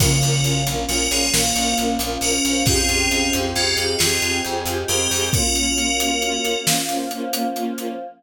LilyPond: <<
  \new Staff \with { instrumentName = "Tubular Bells" } { \time 12/8 \key bes \minor \tempo 4. = 90 <ges' bes'>4. r8 <ges' bes'>8 <f' aes'>8 <ges' bes'>4 r4 <ges' bes'>4 | <f' aes'>4. r8 <des' f'>8 ges'8 <f' aes'>4 r4 <g' bes'>4 | <ges' bes'>2. r2. | }
  \new Staff \with { instrumentName = "Flute" } { \time 12/8 \key bes \minor <des f>2 f4 bes4. des'4. | <des' f'>2 aes'4 f'2. | <des' f'>2 r1 | }
  \new Staff \with { instrumentName = "String Ensemble 1" } { \time 12/8 \key bes \minor <des' f' bes'>8 <des' f' bes'>8 <des' f' bes'>8 <des' f' bes'>8 <des' f' bes'>8 <des' f' bes'>8 <des' f' bes'>8 <des' f' bes'>8 <des' f' bes'>8 <des' f' bes'>8 <des' f' bes'>8 <des' f' bes'>8 | <c' f' g' aes'>8 <c' f' g' aes'>8 <c' f' g' aes'>8 <c' f' g' aes'>8 <c' f' g' aes'>8 <c' f' g' aes'>8 <c' f' g' aes'>8 <c' f' g' aes'>8 <c' f' g' aes'>8 <c' f' g' aes'>8 <c' f' g' aes'>8 <c' f' g' aes'>8 | <bes des' f'>8 <bes des' f'>8 <bes des' f'>8 <bes des' f'>8 <bes des' f'>8 <bes des' f'>8 <bes des' f'>8 <bes des' f'>8 <bes des' f'>8 <bes des' f'>8 <bes des' f'>8 <bes des' f'>8 | }
  \new Staff \with { instrumentName = "Electric Bass (finger)" } { \clef bass \time 12/8 \key bes \minor bes,,8 bes,,8 bes,,8 bes,,8 bes,,8 bes,,8 bes,,8 bes,,8 bes,,8 bes,,8 bes,,8 bes,,8 | f,8 f,8 f,8 f,8 f,8 f,8 f,8 f,8 f,8 f,8 f,8 f,8 | r1. | }
  \new Staff \with { instrumentName = "Choir Aahs" } { \time 12/8 \key bes \minor <bes des' f'>2. <f bes f'>2. | <aes c' f' g'>2. <aes c' g' aes'>2. | <bes des' f'>2. <f bes f'>2. | }
  \new DrumStaff \with { instrumentName = "Drums" } \drummode { \time 12/8 <cymc bd>8 hh8 hh8 hh8 hh8 hh8 sn8 hh8 hh8 hh8 hh8 hh8 | <hh bd>8 hh8 hh8 hh8 hh8 hh8 sn8 hh8 hh8 hh8 hh8 hho8 | <hh bd>8 hh8 hh8 hh8 hh8 hh8 sn8 hh8 hh8 hh8 hh8 hh8 | }
>>